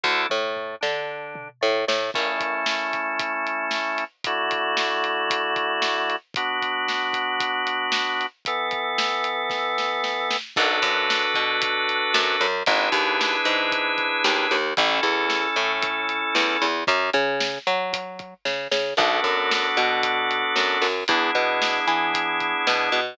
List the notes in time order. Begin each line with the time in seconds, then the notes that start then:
0.04 D2 D4 E4 A4, kick
0.29 A2 A3, mid tom
0.56 floor tom
0.81 D3 D4, snare
1.35 mid tom
1.61 A2 A3
1.87 A2 A3, snare
2.14 A3 C#4 E4, kick, crash
2.40 kick, closed hi-hat
2.66 snare
2.93 kick, closed hi-hat
3.19 kick, closed hi-hat
3.47 closed hi-hat
3.71 snare
3.98 closed hi-hat
4.24 D3 A3 E4 F#4, kick, closed hi-hat
4.51 kick, closed hi-hat
4.77 snare
5.04 closed hi-hat
5.30 kick, closed hi-hat
5.56 kick, closed hi-hat
5.82 snare
6.10 closed hi-hat
6.34 B3 D4 F#4, kick, closed hi-hat
6.62 kick, closed hi-hat
6.88 snare
7.13 kick, closed hi-hat
7.40 kick, closed hi-hat
7.67 closed hi-hat
7.92 snare
8.21 closed hi-hat
8.45 E3 B3 A4, kick, closed hi-hat
8.71 kick, closed hi-hat
8.98 snare
9.24 closed hi-hat
9.50 kick, snare
9.78 snare
10.04 snare
10.30 snare
10.56 B1 D4 F#4 A4 B4, kick, crash
10.82 F#2, kick, closed hi-hat
11.10 snare
11.34 B2, kick, closed hi-hat
11.62 kick, closed hi-hat
11.89 closed hi-hat
12.14 F#2, snare
12.41 F#2, closed hi-hat
12.66 G#1 D4 E4 G#4 B4, kick, closed hi-hat
12.92 D#2, kick, closed hi-hat
13.21 snare
13.45 G#2, closed hi-hat
13.72 kick, closed hi-hat
13.98 kick, closed hi-hat
14.24 D#2, snare
14.51 D#2, closed hi-hat
14.77 A1 C#4 E4 A4, kick, closed hi-hat
15.03 E2, kick, closed hi-hat
15.30 snare
15.56 A2, closed hi-hat
15.82 kick, closed hi-hat
16.09 closed hi-hat
16.35 E2, snare
16.62 E2, closed hi-hat
16.87 F#2, kick, closed hi-hat
17.13 C#3, kick, closed hi-hat
17.40 snare
17.67 F#3, closed hi-hat
17.93 kick, closed hi-hat
18.19 kick, closed hi-hat
18.45 C#3, kick, snare
18.71 C#3, snare
18.97 B1 B3 D4 F#4 A4, kick, crash
19.24 F#2, kick, closed hi-hat
19.51 snare
19.77 B2, kick, closed hi-hat
20.03 kick, closed hi-hat
20.31 closed hi-hat
20.56 F#2, snare
20.81 F#2, open hi-hat
21.08 E2 B3 D4 E4 G#4, kick, closed hi-hat
21.35 B2, kick, closed hi-hat
21.62 snare
21.87 E3, closed hi-hat
22.14 kick, closed hi-hat
22.40 kick, closed hi-hat
22.67 B2, snare
22.92 B2, closed hi-hat